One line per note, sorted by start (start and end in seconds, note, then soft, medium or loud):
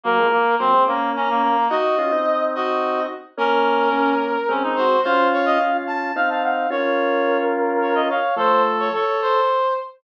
0.04 0.18 F#3 loud
0.04 0.27 A#3 medium
0.04 0.18 A#3 loud
0.04 0.55 A#4 medium
0.19 0.32 F3 medium
0.19 0.32 G#3 loud
0.31 0.55 A#3 medium
0.59 0.73 F#3 medium
0.59 0.73 A#3 loud
0.59 0.84 C4 medium
0.59 0.83 C5 medium
0.74 0.87 G#3 medium
0.74 0.87 C4 loud
0.87 1.12 A#3 medium
0.87 1.56 A#3 medium
0.87 1.56 C#4 loud
0.87 1.11 A#5 medium
1.16 1.29 C#4 medium
1.16 1.65 A#5 medium
1.30 1.42 A#3 medium
1.42 1.68 A#3 medium
1.70 1.96 D#4 loud
1.70 1.96 F#4 loud
1.70 1.97 F#4 medium
1.70 2.43 D#5 medium
1.98 2.12 C#4 medium
1.98 2.12 F4 loud
2.12 3.07 C4 medium
2.12 3.07 D#4 loud
2.55 3.00 F#4 medium
2.55 3.03 D#5 medium
3.38 3.89 A#3 loud
3.38 3.89 C#4 loud
3.38 4.14 C#4 medium
3.38 4.53 A#4 medium
3.92 4.37 A#3 medium
3.92 4.37 C#4 loud
4.49 4.97 G#3 loud
4.49 4.97 C4 loud
4.49 4.63 C#4 medium
4.63 4.76 D#4 medium
4.76 5.00 F#4 medium
4.76 5.01 C5 medium
5.03 5.58 C#4 loud
5.03 5.58 F4 loud
5.03 5.28 C5 medium
5.03 5.77 F5 medium
5.33 5.46 C#5 medium
5.46 5.59 D#5 medium
5.61 6.12 C#4 medium
5.61 6.12 F4 medium
5.87 6.13 A5 medium
6.16 6.67 C4 medium
6.16 6.67 D#4 loud
6.16 6.29 F5 medium
6.16 6.30 F5 medium
6.29 6.43 F5 medium
6.29 6.42 A5 medium
6.43 6.69 F5 medium
6.43 6.68 F#5 medium
6.70 8.10 C#4 loud
6.70 8.10 F4 loud
6.70 8.02 A#4 medium
6.70 7.38 C#5 medium
7.82 7.95 C#5 medium
7.95 8.08 D#5 medium
8.09 8.36 C#5 medium
8.09 8.35 F5 medium
8.36 8.90 F3 loud
8.36 8.90 A3 loud
8.36 8.88 A4 medium
8.36 8.63 C5 medium
8.80 8.93 C#5 medium
8.93 9.40 A4 medium
8.93 9.21 C#5 medium
9.22 9.74 C5 medium